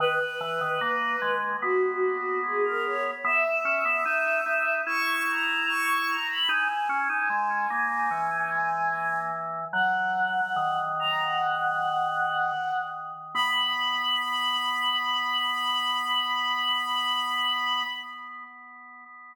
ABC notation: X:1
M:4/4
L:1/16
Q:1/4=74
K:B
V:1 name="Choir Aahs"
B8 F4 G A c z | e8 c'2 a2 c'2 a b | g16 | "^rit." f6 a f7 z2 |
b16 |]
V:2 name="Drawbar Organ"
D, z E, D, A,2 G,2 B,8 | B, z C B, D2 D2 E8 | D z C D G,2 A,2 E,8 | "^rit." F,4 D,10 z2 |
B,16 |]